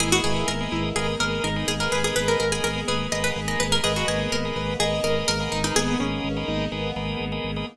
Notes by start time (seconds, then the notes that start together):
0.00 G#1 A#3 B3 D#4 E4 G#4 A#4 B4 D#5
0.12 F#4 G#4 A#4 B4 D#5
0.24 G#1 G#4 A#4 B4 D#5
0.48 G#1 A#4
0.60 G#4 A#4 B4 D#5
0.72 G#1 E4
0.96 G#1 G#4 A#4 B4 D#5
1.20 G#1 G#4 A#4 B4 D#5
1.44 G#1 D#4 A#4
1.56 G#4 A#4 B4 D#5
1.68 G#1 G#4
1.80 G#4 A#4 B4 D#5
1.92 G#1 G#4 B4
2.04 G#4 A#4 B4 D#5
2.16 G#1 G#4 A#4 B4 D#5
2.28 A#4
2.40 G#1 A#4
2.52 G#4 A#4 B4 D#5
2.64 G#1 G#4 A#4
2.88 G#1 G#4 A#4 B4 D#5
3.12 G#1 G#4 A#4 B4 D#5
3.24 B4
3.36 G#1 G#4
3.48 G#4 A#4 B4 D#5
3.60 G#1 B4
3.72 G#4 A#4 B4 D#5
3.83 G#1 A#3 B3 D#4 G#4 A#4 B4 D#5
3.96 F#4 G#4 A#4 B4 D#5
4.08 G#1 G#4 A#4 B4 D#5
4.32 G#1 A#4
4.45 G#4 A#4 B4 D#5
4.56 G#1 B4
4.80 G#1 G#4 A#4 B4 D#5
5.04 G#1 G#4 A#4 B4 D#5
5.28 G#1 A#4
5.40 G#4 A#4 B4 D#5
5.52 G#1 D#4
5.64 D#4 G#4 A#4 B4 D#5
5.76 G#1 B3 G#4
5.88 G#4 A#4 B4 D#5
6.00 G#1 C#4 G#4 A#4 B4 D#5
6.24 G#1
6.37 G#4 A#4 B4 D#5
6.48 G#1 D#4
6.72 G#1 B3 G#4 A#4 B4 D#5
6.96 G#1 G#4 A#4 B4 D#5
7.20 G#1
7.32 G#4 A#4 B4 D#5
7.44 G#1
7.56 G#4 A#4 B4 D#5